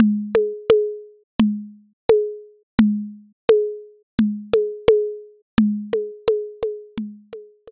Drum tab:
CG |Ooo-O-o-|O-o-Ooo-|OoooOoo-|